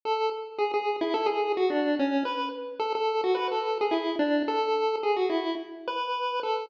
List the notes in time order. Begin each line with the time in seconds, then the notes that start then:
0.05 A4
0.58 G#4
0.74 G#4
1.01 E4
1.14 A4
1.26 G#4
1.57 F#4
1.70 D4
1.99 C#4
2.25 B4
2.80 A4
2.95 A4
3.24 F#4
3.35 B4
3.51 A4
3.81 G#4
3.91 E4
4.19 D4
4.48 A4
5.03 G#4
5.16 F#4
5.30 E4
5.88 B4
6.43 A4